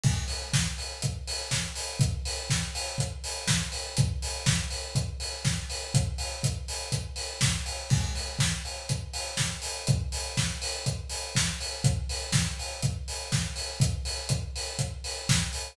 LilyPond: \new DrumStaff \drummode { \time 4/4 \tempo 4 = 122 <cymc bd>8 hho8 <bd sn>8 hho8 <hh bd>8 hho8 <bd sn>8 hho8 | <hh bd>8 hho8 <bd sn>8 hho8 <hh bd>8 hho8 <bd sn>8 hho8 | <hh bd>8 hho8 <bd sn>8 hho8 <hh bd>8 hho8 <bd sn>8 hho8 | <hh bd>8 hho8 <hh bd>8 hho8 <hh bd>8 hho8 <bd sn>8 hho8 |
<cymc bd>8 hho8 <bd sn>8 hho8 <hh bd>8 hho8 <bd sn>8 hho8 | <hh bd>8 hho8 <bd sn>8 hho8 <hh bd>8 hho8 <bd sn>8 hho8 | <hh bd>8 hho8 <bd sn>8 hho8 <hh bd>8 hho8 <bd sn>8 hho8 | <hh bd>8 hho8 <hh bd>8 hho8 <hh bd>8 hho8 <bd sn>8 hho8 | }